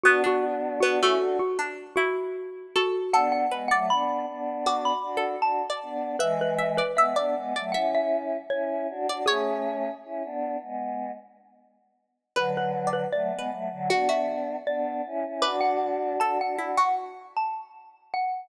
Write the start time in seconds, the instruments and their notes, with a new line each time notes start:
0.04 pizzicato strings B3, choir aahs B3 D4, xylophone F#4
0.24 pizzicato strings D4, xylophone F#4
0.80 pizzicato strings B3, choir aahs B3 D4, xylophone F#4
1.00 pizzicato strings A3, choir aahs C#4 E4, xylophone F#4
1.19 choir aahs D4 F#4
1.39 xylophone F#4
1.59 pizzicato strings D4
1.96 pizzicato strings E4, xylophone F#4
2.76 xylophone F#4, pizzicato strings A4
3.13 choir aahs B3 D4, pizzicato strings A4, xylophone F#5
3.32 xylophone F#5
3.51 choir aahs G#3 B3, pizzicato strings B4
3.68 choir aahs F#3 A3, pizzicato strings D5, xylophone F#5
3.90 choir aahs B3 D4, xylophone B5
4.28 choir aahs B3 D4
4.66 pizzicato strings F#4, xylophone D6
4.85 xylophone B5
5.03 choir aahs D4 F#4
5.17 pizzicato strings A4
5.42 choir aahs D4 F#4, xylophone A5
5.70 pizzicato strings D5
5.83 choir aahs B3 D4
6.19 choir aahs E3 G#3, xylophone B4, pizzicato strings E5
6.41 xylophone B4
6.58 pizzicato strings E5
6.77 xylophone B4, pizzicato strings D5
6.95 choir aahs G#3 B3, xylophone E5, pizzicato strings E5
7.16 choir aahs B3 D4, pizzicato strings D5
7.35 choir aahs G#3 B3
7.56 choir aahs F#3 A3, pizzicato strings D5
7.72 choir aahs C#4 E4, pizzicato strings E5, xylophone F#5
7.95 xylophone E5
8.50 choir aahs C#4 E4, xylophone C#5
8.90 choir aahs D4 F#4
9.08 choir aahs D4 F#4, pizzicato strings D5
9.26 choir aahs A3 C#4, xylophone G#4, pizzicato strings C#5
10.04 choir aahs C#4 E4
10.24 choir aahs B3 D4
10.62 choir aahs G#3 B3
12.36 choir aahs D3 F#3, pizzicato strings B4, xylophone B4
12.57 xylophone B4
12.87 pizzicato strings D5
12.93 xylophone B4
13.13 choir aahs F#3 A3, xylophone D5
13.32 choir aahs G#3 B3
13.39 pizzicato strings B4
13.51 choir aahs F#3 A3
13.71 choir aahs D3 F#3
13.90 choir aahs B3 D4, pizzicato strings F#4, xylophone F#5
14.09 pizzicato strings F#4, xylophone E5
14.66 choir aahs B3 D4, xylophone D5
15.06 choir aahs C#4 E4
15.26 choir aahs C#4 E4
15.42 choir aahs D4 F#4, pizzicato strings B4, xylophone D6
15.61 xylophone F#5
16.20 choir aahs D4 F#4, pizzicato strings A4, xylophone A5
16.41 choir aahs D4 F#4, xylophone F#5
16.57 choir aahs D4 F#4, pizzicato strings E4
16.77 pizzicato strings F#4, xylophone F#5
17.37 xylophone A5
18.14 xylophone F#5